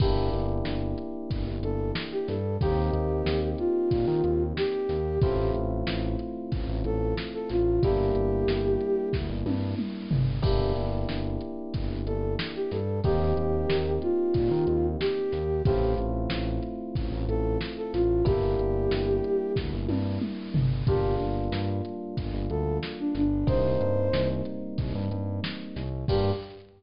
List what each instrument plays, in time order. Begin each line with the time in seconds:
0.00 synth bass 1 G1, electric piano 1 A#3 D4 E4 G4, flute G4, kick, crash
0.33 synth bass 1 G1, closed hi-hat
0.65 synth bass 1 G1, snare
0.98 closed hi-hat
1.30 synth bass 1 G1, kick, closed hi-hat
1.47 synth bass 1 G1
1.63 synth bass 1 G1, flute A4, closed hi-hat
1.95 snare
2.12 flute G4
2.28 synth bass 1 G2, flute A4, snare, closed hi-hat
2.61 synth bass 1 D#2, electric piano 1 A#3 C4 D#4 G4, flute G4, kick, closed hi-hat
2.93 synth bass 1 D#2, closed hi-hat
3.26 synth bass 1 D#2, snare
3.58 flute F4, closed hi-hat
3.91 synth bass 1 A#2, kick, closed hi-hat
4.07 synth bass 1 D#3
4.24 synth bass 1 D#2, closed hi-hat
4.57 flute G4, snare
4.89 synth bass 1 D#2, snare, closed hi-hat
5.21 synth bass 1 A1, electric piano 1 A3 C4 E4 F4, flute G4, kick, closed hi-hat
5.54 synth bass 1 A1, closed hi-hat
5.87 synth bass 1 A1, snare
6.19 closed hi-hat
6.52 synth bass 1 A1, kick, closed hi-hat
6.69 synth bass 1 A1
6.84 synth bass 1 A1, flute A4, closed hi-hat
7.17 snare
7.34 flute A4
7.49 synth bass 1 A1, flute F4, snare, closed hi-hat
7.82 synth bass 1 G1, electric piano 1 G3 A#3 D4 E4, flute G4, kick, closed hi-hat
8.15 synth bass 1 G1, closed hi-hat
8.48 synth bass 1 G1, snare
8.81 closed hi-hat
9.13 synth bass 1 D2, kick, snare
9.29 synth bass 1 G1
9.45 synth bass 1 G2, high tom
9.78 mid tom
10.11 synth bass 1 G1, floor tom
10.42 synth bass 1 G1, electric piano 1 A#3 D4 E4 G4, flute G4, kick, crash
10.76 synth bass 1 G1, closed hi-hat
11.09 synth bass 1 G1, snare
11.41 closed hi-hat
11.74 synth bass 1 G1, kick, closed hi-hat
11.90 synth bass 1 G1
12.06 synth bass 1 G1, flute A4, closed hi-hat
12.39 snare
12.55 flute G4
12.71 synth bass 1 G2, flute A4, snare, closed hi-hat
13.04 synth bass 1 D#2, electric piano 1 A#3 C4 D#4 G4, flute G4, kick, closed hi-hat
13.37 synth bass 1 D#2, closed hi-hat
13.69 synth bass 1 D#2, snare
14.02 flute F4, closed hi-hat
14.34 synth bass 1 A#2, kick, closed hi-hat
14.51 synth bass 1 D#3
14.67 synth bass 1 D#2, closed hi-hat
15.00 flute G4, snare
15.32 synth bass 1 D#2, snare, closed hi-hat
15.65 synth bass 1 A1, electric piano 1 A3 C4 E4 F4, flute G4, kick, closed hi-hat
15.98 synth bass 1 A1, closed hi-hat
16.30 synth bass 1 A1, snare
16.63 closed hi-hat
16.95 synth bass 1 A1, kick, closed hi-hat
17.12 synth bass 1 A1
17.28 synth bass 1 A1, flute A4, closed hi-hat
17.61 snare
17.77 flute A4
17.93 synth bass 1 A1, flute F4, snare, closed hi-hat
18.25 synth bass 1 G1, electric piano 1 G3 A#3 D4 E4, flute G4, kick, closed hi-hat
18.59 synth bass 1 G1, closed hi-hat
18.91 synth bass 1 G1, snare
19.24 closed hi-hat
19.56 synth bass 1 D2, kick, snare
19.73 synth bass 1 G1
19.88 synth bass 1 G2, high tom
20.21 mid tom
20.54 synth bass 1 G1, floor tom
20.87 synth bass 1 G1, electric piano 1 G3 A#3 D4 F4, flute G4, kick, closed hi-hat
21.20 synth bass 1 G1, closed hi-hat
21.52 synth bass 1 G2, snare
21.85 closed hi-hat
22.17 synth bass 1 G1, kick, closed hi-hat
22.34 synth bass 1 G1
22.50 synth bass 1 D2, flute A4, closed hi-hat
22.83 snare
22.99 flute D4
23.15 synth bass 1 G1, flute D4, snare, closed hi-hat
23.47 synth bass 1 C2, electric piano 1 G3 A#3 C4 D#4, flute C5, kick, closed hi-hat
23.81 synth bass 1 G2, closed hi-hat
24.13 synth bass 1 C2, snare
24.45 closed hi-hat
24.78 synth bass 1 C2, kick, closed hi-hat
24.95 synth bass 1 G2
25.11 synth bass 1 G2, closed hi-hat
25.44 snare
25.76 synth bass 1 C2, snare, closed hi-hat
26.08 synth bass 1 G2, electric piano 1 A#3 D4 F4 G4, flute G4, kick, crash